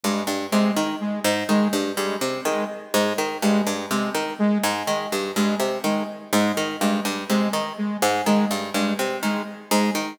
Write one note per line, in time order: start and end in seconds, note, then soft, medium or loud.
0.03 0.23 G2 medium
0.03 0.23 G#3 medium
0.27 0.46 G2 medium
0.52 0.72 C3 medium
0.52 0.71 G#3 medium
0.76 0.96 D#3 medium
1.00 1.20 G#3 medium
1.24 1.44 G#2 medium
1.49 1.68 D#3 medium
1.49 1.68 G#3 medium
1.73 1.92 G2 medium
1.97 2.16 G2 medium
1.97 2.16 G#3 medium
2.21 2.41 C3 medium
2.45 2.65 D#3 medium
2.45 2.65 G#3 medium
2.94 3.13 G#2 medium
2.94 3.13 G#3 medium
3.18 3.38 D#3 medium
3.42 3.62 G2 medium
3.42 3.61 G#3 medium
3.67 3.86 G2 medium
3.91 4.10 C3 medium
3.91 4.10 G#3 medium
4.15 4.34 D#3 medium
4.39 4.58 G#3 medium
4.63 4.83 G#2 medium
4.87 5.07 D#3 medium
4.87 5.07 G#3 medium
5.12 5.32 G2 medium
5.36 5.55 G2 medium
5.36 5.55 G#3 medium
5.60 5.79 C3 medium
5.84 6.03 D#3 medium
5.84 6.04 G#3 medium
6.33 6.52 G#2 medium
6.33 6.52 G#3 medium
6.57 6.76 D#3 medium
6.81 7.00 G2 medium
6.81 7.01 G#3 medium
7.05 7.24 G2 medium
7.29 7.49 C3 medium
7.29 7.48 G#3 medium
7.53 7.73 D#3 medium
7.78 7.97 G#3 medium
8.02 8.22 G#2 medium
8.26 8.46 D#3 medium
8.26 8.45 G#3 medium
8.51 8.70 G2 medium
8.74 8.94 G2 medium
8.74 8.94 G#3 medium
8.99 9.18 C3 medium
9.23 9.42 D#3 medium
9.23 9.42 G#3 medium
9.71 9.91 G#2 medium
9.71 9.91 G#3 medium
9.95 10.14 D#3 medium